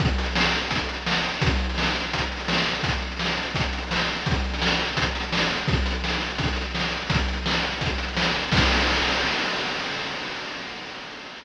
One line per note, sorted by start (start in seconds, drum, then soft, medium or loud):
0.00 kick loud
0.00 closed hi-hat medium
0.09 closed hi-hat medium
0.18 closed hi-hat medium
0.26 closed hi-hat medium
0.36 snare loud
0.45 closed hi-hat medium
0.53 closed hi-hat medium
0.62 closed hi-hat medium
0.71 kick medium
0.71 closed hi-hat medium
0.79 closed hi-hat medium
0.89 closed hi-hat medium
0.97 closed hi-hat medium
1.06 snare medium
1.15 closed hi-hat medium
1.24 closed hi-hat medium
1.34 closed hi-hat medium
1.41 kick loud
1.41 closed hi-hat loud
1.51 closed hi-hat medium
1.59 closed hi-hat medium
1.69 closed hi-hat medium
1.78 snare medium
1.87 closed hi-hat medium
1.95 closed hi-hat medium
2.04 closed hi-hat medium
2.13 kick medium
2.13 closed hi-hat medium
2.21 closed hi-hat medium
2.32 closed hi-hat medium
2.40 closed hi-hat medium
2.48 snare loud
2.58 closed hi-hat medium
2.67 closed hi-hat medium
2.75 closed hi-hat medium
2.83 kick medium
2.83 closed hi-hat medium
2.93 closed hi-hat medium
3.02 closed hi-hat medium
3.12 closed hi-hat medium
3.19 snare medium
3.29 closed hi-hat medium
3.37 closed hi-hat medium
3.46 closed hi-hat medium
3.55 kick medium
3.55 closed hi-hat medium
3.64 closed hi-hat medium
3.73 closed hi-hat medium
3.82 closed hi-hat medium
3.91 snare medium
3.99 closed hi-hat medium
4.08 closed hi-hat medium
4.16 closed hi-hat medium
4.26 kick medium
4.26 closed hi-hat medium
4.34 closed hi-hat medium
4.44 closed hi-hat medium
4.54 closed hi-hat medium
4.62 snare loud
4.70 closed hi-hat medium
4.80 closed hi-hat medium
4.88 closed hi-hat medium
4.97 kick medium
4.97 closed hi-hat loud
5.06 closed hi-hat medium
5.15 closed hi-hat medium
5.23 closed hi-hat medium
5.32 snare loud
5.41 closed hi-hat medium
5.50 closed hi-hat medium
5.59 closed hi-hat medium
5.68 kick loud
5.68 closed hi-hat medium
5.77 closed hi-hat medium
5.86 closed hi-hat medium
5.95 closed hi-hat medium
6.04 snare medium
6.13 closed hi-hat medium
6.21 closed hi-hat medium
6.30 closed hi-hat medium
6.38 kick medium
6.38 closed hi-hat medium
6.48 closed hi-hat medium
6.56 closed hi-hat medium
6.65 closed hi-hat medium
6.75 snare medium
6.83 closed hi-hat medium
6.91 closed hi-hat medium
7.02 closed hi-hat medium
7.10 kick loud
7.10 closed hi-hat loud
7.19 closed hi-hat medium
7.28 closed hi-hat medium
7.37 closed hi-hat medium
7.46 snare medium
7.55 closed hi-hat medium
7.63 closed hi-hat medium
7.72 closed hi-hat medium
7.81 kick medium
7.81 closed hi-hat medium
7.90 closed hi-hat medium
7.98 closed hi-hat medium
8.08 closed hi-hat medium
8.17 snare loud
8.26 closed hi-hat medium
8.35 closed hi-hat medium
8.43 closed hi-hat medium
8.52 kick loud
8.52 crash loud